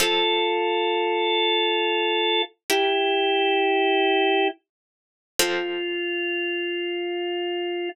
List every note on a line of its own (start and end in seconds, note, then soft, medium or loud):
0.00 2.64 F3 medium
0.00 2.64 C4 medium
0.00 2.42 F4 medium
0.00 2.64 A4 medium
0.00 2.42 A4 loud
2.70 4.47 E4 medium
2.70 5.34 E4 medium
2.70 4.47 G4 loud
2.70 5.34 G4 medium
2.70 5.34 A#4 medium
5.39 7.89 F3 medium
5.39 7.89 C4 loud
5.39 7.89 F4 loud
5.39 7.89 A4 loud